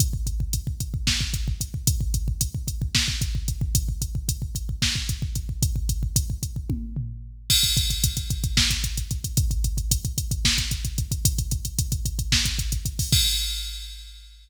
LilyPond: \new DrumStaff \drummode { \time 7/8 \tempo 4 = 112 <hh bd>16 bd16 <hh bd>16 bd16 <hh bd>16 bd16 <hh bd>16 bd16 <bd sn>16 bd16 <hh bd>16 bd16 <hh bd>16 bd16 | <hh bd>16 bd16 <hh bd>16 bd16 <hh bd>16 bd16 <hh bd>16 bd16 <bd sn>16 bd16 <hh bd>16 bd16 <hh bd>16 bd16 | <hh bd>16 bd16 <hh bd>16 bd16 <hh bd>16 bd16 <hh bd>16 bd16 <bd sn>16 bd16 <hh bd>16 bd16 <hh bd>16 bd16 | <hh bd>16 bd16 <hh bd>16 bd16 <hh bd>16 bd16 <hh bd>16 bd16 <bd tommh>8 tomfh4 |
<cymc bd>16 <hh bd>16 <hh bd>16 <hh bd>16 <hh bd>16 <hh bd>16 <hh bd>16 <hh bd>16 <bd sn>16 <hh bd>16 <hh bd>16 <hh bd>16 <hh bd>16 <hh bd>16 | <hh bd>16 <hh bd>16 <hh bd>16 <hh bd>16 <hh bd>16 <hh bd>16 <hh bd>16 <hh bd>16 <bd sn>16 <hh bd>16 <hh bd>16 <hh bd>16 <hh bd>16 <hh bd>16 | <hh bd>16 <hh bd>16 <hh bd>16 <hh bd>16 <hh bd>16 <hh bd>16 <hh bd>16 <hh bd>16 <bd sn>16 <hh bd>16 <hh bd>16 <hh bd>16 <hh bd>16 <hho bd>16 | <cymc bd>4 r4 r4. | }